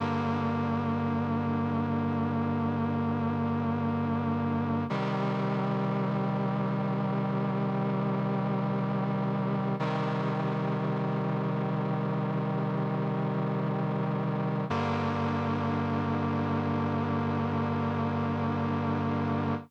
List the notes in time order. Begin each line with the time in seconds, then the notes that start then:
0.00 G2 D3 A#3
4.90 C3 D#3 G3
9.79 C3 D#3 G3
14.70 G2 D3 A#3